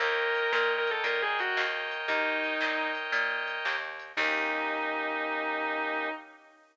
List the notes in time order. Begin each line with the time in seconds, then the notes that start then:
0.00 D#2 A#4 C#5 D#5 G5, kick, closed hi-hat
0.35 closed hi-hat
0.52 A#2 A#4, snare
0.78 A#4
0.87 A4, closed hi-hat
1.04 A#2 A#4, kick, closed hi-hat
1.22 G#4
1.39 F#4, closed hi-hat
1.57 D#2, snare
1.91 closed hi-hat
2.08 D#2 D#4, kick, closed hi-hat
2.44 closed hi-hat
2.61 A#2, snare
2.95 closed hi-hat
3.12 A#2, kick, closed hi-hat
3.47 closed hi-hat
3.65 D#2, snare
4.00 closed hi-hat
4.17 D#2 A#3 C#4 D#4 G4, kick, crash